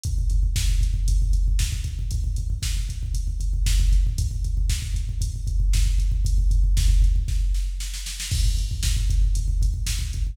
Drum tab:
CC |----------------|----------------|----------------|----------------|
HH |x-x---x-x-x---x-|x-x---x-x-x---x-|x-x---x-x-x---x-|x-x---x---------|
SD |----o-------o---|----o-------o---|----o-------o---|----o---o-o-oooo|
BD |oooooooooooooooo|oooooooooooooooo|oooooooooooooooo|ooooooooo-------|

CC |x---------------|
HH |--x---x-x-x---x-|
SD |----o-------o---|
BD |oooooooooooooooo|